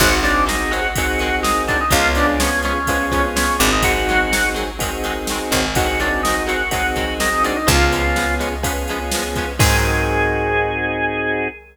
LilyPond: <<
  \new Staff \with { instrumentName = "Drawbar Organ" } { \time 4/4 \key aes \major \tempo 4 = 125 ges'8 d'8 ees'8 ges'4. ees'8 d'16 ees'16 | f'8 d'8 des'8 des'4. des'8 d'16 ees'16 | ges'4. r2 r8 | ges'8 d'8 ees'8 ges'4. ees'8 d'16 ees'16 |
f'4. r2 r8 | aes'1 | }
  \new Staff \with { instrumentName = "Overdriven Guitar" } { \time 4/4 \key aes \major <ees ges aes c'>8 <ees ges aes c'>8 <ees ges aes c'>8 <ees ges aes c'>8 <ees ges aes c'>8 <ees ges aes c'>8 <ees ges aes c'>8 <ees ges aes c'>8 | <f aes ces' des'>8 <f aes ces' des'>8 <f aes ces' des'>8 <f aes ces' des'>8 <f aes ces' des'>8 <f aes ces' des'>8 <f aes ces' des'>8 <f aes ces' des'>8 | <ees ges aes c'>8 <ees ges aes c'>8 <ees ges aes c'>8 <ees ges aes c'>8 <ees ges aes c'>8 <ees ges aes c'>8 <ees ges aes c'>8 <ees ges aes c'>8 | <ees ges aes c'>8 <ees ges aes c'>8 <ees ges aes c'>8 <ees ges aes c'>8 <ees ges aes c'>8 <ees ges aes c'>8 <ees ges aes c'>8 <ees ges aes c'>8 |
<f aes ces' des'>8 <f aes ces' des'>8 <f aes ces' des'>8 <f aes ces' des'>8 <f aes ces' des'>8 <f aes ces' des'>8 <f aes ces' des'>8 <f aes ces' des'>8 | <ees ges aes c'>1 | }
  \new Staff \with { instrumentName = "Drawbar Organ" } { \time 4/4 \key aes \major <c' ees' ges' aes'>2 <c' ees' ges' aes'>2 | <ces' des' f' aes'>2 <ces' des' f' aes'>4. <c' ees' ges' aes'>8~ | <c' ees' ges' aes'>2 <c' ees' ges' aes'>2 | <c' ees' ges' aes'>2 <c' ees' ges' aes'>2 |
<ces' des' f' aes'>2 <ces' des' f' aes'>2 | <c' ees' ges' aes'>1 | }
  \new Staff \with { instrumentName = "Electric Bass (finger)" } { \clef bass \time 4/4 \key aes \major aes,,1 | des,2.~ des,8 aes,,8~ | aes,,2.~ aes,,8 aes,,8~ | aes,,1 |
des,1 | aes,1 | }
  \new DrumStaff \with { instrumentName = "Drums" } \drummode { \time 4/4 <cymc bd>8 cymr8 sn8 cymr8 <bd cymr>8 cymr8 sn8 <bd cymr>8 | <bd cymr>8 cymr8 sn8 cymr8 <bd cymr>8 <bd cymr>8 sn8 cymr8 | <bd cymr>8 cymr8 sn8 cymr8 <bd cymr>8 cymr8 sn8 <bd cymr>8 | <bd cymr>8 cymr8 sn8 cymr8 <bd cymr>8 <bd cymr>8 sn8 cymr8 |
<bd cymr>8 cymr8 sn8 cymr8 <bd cymr>8 cymr8 sn8 <bd cymr>8 | <cymc bd>4 r4 r4 r4 | }
>>